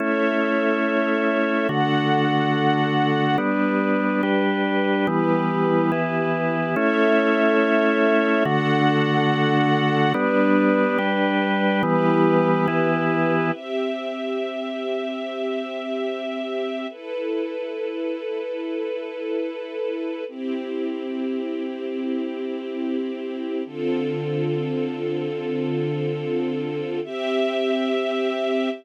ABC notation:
X:1
M:6/8
L:1/8
Q:3/8=71
K:Amix
V:1 name="Drawbar Organ"
[A,CE]6 | [D,A,F]6 | [G,B,D]3 [G,DG]3 | [E,G,B,]3 [E,B,E]3 |
[A,CE]6 | [D,A,F]6 | [G,B,D]3 [G,DG]3 | [E,G,B,]3 [E,B,E]3 |
[K:Cmix] z6 | z6 | z6 | z6 |
z6 | z6 | z6 | z6 |
z6 |]
V:2 name="String Ensemble 1"
[Ace]6 | [DAf]6 | [G,DB]6 | [EGB]6 |
[Ace]6 | [DAf]6 | [G,DB]6 | [EGB]6 |
[K:Cmix] [CGe]6- | [CGe]6 | [EA=B]6- | [EA=B]6 |
[CEG]6- | [CEG]6 | [D,CFA]6- | [D,CFA]6 |
[CGe]6 |]